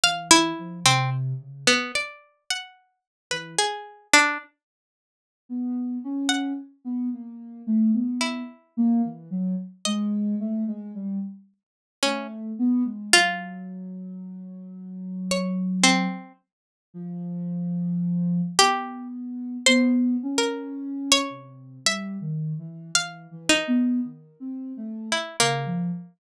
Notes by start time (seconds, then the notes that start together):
0.03 E3 F5
0.31 E4
0.59 F3
0.85 C3 C4
1.40 C#3
1.67 B3
1.95 D5
2.50 F#5
3.31 E3 B4
3.58 G#4
4.13 D4
5.49 B3
6.04 C#4
6.29 F#5
6.85 B3
7.13 A#3
7.67 A3
7.94 B3
8.21 E4
8.77 A#3
9.04 E3
9.30 F#3
9.85 G#3 D#5
10.40 A3
10.67 G#3
10.94 G3
12.02 A3 C#4
12.59 B3
12.85 G#3
13.12 F#3 F4
15.31 C#5
15.83 C4
16.94 F3
18.59 B3 G4
19.66 B3 C5
20.23 C#4
20.38 A#4
21.12 C#5
21.30 C3
21.85 G3 E5
22.21 D#3
22.58 E3
22.94 E3 F5
23.31 E3
23.49 D#4
23.67 B3
24.04 D#3
24.40 C4
24.77 A3
25.12 E4
25.40 C#3 A#3
25.66 F3